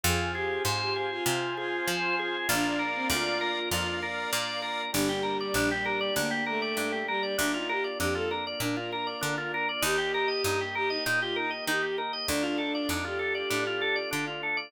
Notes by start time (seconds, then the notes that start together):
0.03 F2 C4 F4 G#4 C5 F5 G#5
0.34 G4 G#4
0.65 G#2 C5
0.80 G4
0.96 G#4
1.11 F4
1.26 C3 F4 C5 F5 G#5
1.57 F4 G#4
1.87 F3 C5
2.19 G#4
2.47 A#1 A#3 D4 F4 A#4 D5 F5
2.65 D4
2.79 A#4
2.95 C4
3.09 D2 F4 D5
3.41 A#4
3.71 F2 F4 A#4 D5 F5
4.02 A#4
4.33 A#2 D5
4.62 A#4
4.92 G1 G3 A#3 D4 G4
5.09 G4
5.23 A#4
5.40 D5
5.54 A#1 D4
5.71 G4
5.85 A#4
6.01 D5
6.16 D2 A#3 D4
6.31 G4
6.46 A3 A#4
6.62 D5
6.77 G2 D4
6.92 G4
7.07 G3 A#4
7.23 D5
7.37 D2 A#3 D4 F4
7.54 D#4 F4
7.69 G4 A#4
7.84 D5
7.99 F2 D4 G4
8.14 F4 A4
8.31 A#4
8.47 D5
8.60 A#2 D4 A#4
8.77 F4
8.92 A#4
9.07 D5
9.21 D3 D4
9.38 F4
9.54 A#4
9.69 D5
9.82 D#2 A#3 D#4 G4
9.98 G4
10.14 A#4
10.28 D#5
10.44 G2 D#4
10.61 G4
10.75 G4 A#4
10.89 D#4 D#5
11.06 A#2 D#4
11.21 F4 G4
11.36 D#4 A#4
11.50 D#5
11.67 D#3 D#4 G4
11.82 G4
11.98 A#4
12.13 D#5
12.28 D2 A3 D4 F4
12.43 F4
12.58 A4
12.75 D5
12.89 F2 D4 D#4
13.05 F4 G4
13.19 A4
13.35 D5
13.50 A2 D4
13.67 F4
13.81 A4
13.96 D5
14.11 D3 D4
14.27 F4
14.43 A4
14.57 D5